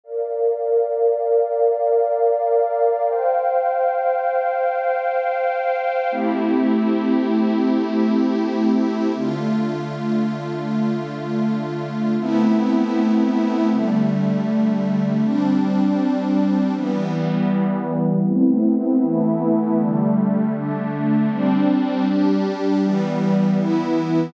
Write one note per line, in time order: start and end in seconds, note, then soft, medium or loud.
0.04 3.04 A#4 medium
0.04 3.04 D5 medium
0.04 3.04 F5 medium
3.07 6.08 C5 medium
3.07 6.08 F5 medium
3.07 6.08 G5 medium
6.11 9.12 A3 medium
6.11 9.12 C4 medium
6.11 9.12 E4 medium
6.11 9.12 G4 medium
9.15 12.16 D3 medium
9.15 12.16 A3 medium
9.15 12.16 F4 medium
12.19 13.69 A3 medium
12.19 13.69 B3 medium
12.19 13.69 C4 medium
12.19 13.69 E4 medium
13.71 15.21 D3 medium
13.71 15.21 G3 medium
13.71 15.21 A3 medium
15.22 16.72 G3 medium
15.22 16.72 C4 medium
15.22 16.72 D4 medium
16.74 18.25 E3 medium
16.74 18.25 G3 medium
16.74 18.25 B3 medium
18.26 19.02 A3 medium
18.26 19.02 B3 medium
18.26 19.02 C4 medium
18.26 19.02 E4 medium
19.02 19.77 E3 medium
19.02 19.77 A3 medium
19.02 19.77 B3 medium
19.02 19.77 E4 medium
19.78 20.53 D3 medium
19.78 20.53 G3 medium
19.78 20.53 A3 medium
20.54 21.29 D3 medium
20.54 21.29 A3 medium
20.54 21.29 D4 medium
21.30 22.05 G3 medium
21.30 22.05 C4 medium
21.30 22.05 D4 medium
22.06 22.81 G3 medium
22.06 22.81 D4 medium
22.06 22.81 G4 medium
22.82 23.57 E3 medium
22.82 23.57 G3 medium
22.82 23.57 B3 medium
23.58 24.33 E3 medium
23.58 24.33 B3 medium
23.58 24.33 E4 medium